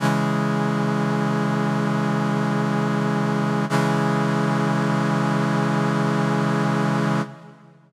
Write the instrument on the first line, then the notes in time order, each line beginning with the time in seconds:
brass section
0.00 C#3 E3 G#3
3.69 C#3 E3 G#3